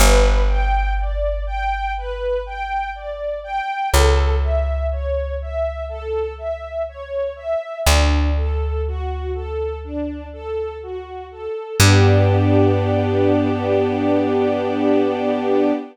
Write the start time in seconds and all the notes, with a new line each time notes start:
0.00 G1 B4
0.49 G5
0.99 D5
1.47 G5
1.97 B4
2.46 G5
2.95 D5
3.44 G5
3.91 C#2 A4
4.42 E5
4.92 C#5
5.41 E5
5.89 A4
6.38 E5
6.89 C#5
7.36 E5
7.85 D2 D4
8.37 A4
8.87 F#4
9.34 A4
9.84 D4
10.33 A4
10.83 F#4
11.31 A4
11.79 G2 B3 D4 G4